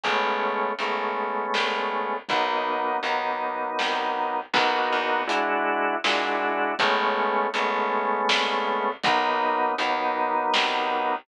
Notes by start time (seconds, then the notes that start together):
0.04 A1 G#3 A3 B3 C#4, kick, closed hi-hat
0.79 G#1 G#3 A3 B3 C#4, closed hi-hat
1.54 C2, snare
2.29 B1 F#3 A#3 B3 D#4, kick, closed hi-hat
3.03 D#2 F#3 A#3 B3 D#4, closed hi-hat
3.79 C2, snare
4.53 B1 A#3 B3 D#4 F#4, kick, crash
4.93 E2
5.27 G#3 D4 E4 F#4, closed hi-hat
6.04 A#2 G#3 D4 E4 F#4, snare
6.79 A1 G#3 A3 B3 C#4, kick, closed hi-hat
7.54 G#1 G#3 A3 B3 C#4, closed hi-hat
8.29 C2, snare
9.04 B1 F#3 A#3 B3 D#4, kick, closed hi-hat
9.78 D#2 F#3 A#3 B3 D#4, closed hi-hat
10.54 C2, snare